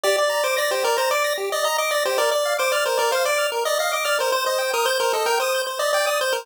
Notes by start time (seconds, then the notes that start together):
0.03 G4 D5
0.17 D5
0.29 A#5
0.44 C5 D6
0.57 D5 A#6
0.71 G4 C5
0.84 A#4 D5
0.97 C5 A#5
1.11 D5 D6
1.24 A#6
1.38 G4
1.52 D5 D#5
1.64 D#5 A#5
1.78 D#5 D6
1.91 D5 A#6
2.05 G4 C5
2.18 A#4 D5
2.31 D5
2.45 F5
2.59 C5 D6
2.72 D5 F6
2.85 A#4 C5
2.97 A#4 D5
3.11 C5 F5
3.25 D5 D6
3.38 F6
3.52 A#4
3.65 D5 D#5
3.79 D#5 F5
3.92 D#5 D6
4.04 D5 F6
4.19 A#4 C5
4.32 C5
4.46 C5 D#5
4.58 G5
4.73 A#4 D#6
4.85 C5 G6
5.00 A#4 C5
5.13 A4 D#5
5.26 A#4 G5
5.40 C5 D#6
5.54 G6
5.67 C5
5.79 D5 D#5
5.93 D5 G5
6.06 D5 D#6
6.21 C5 G6
6.33 A#4 C5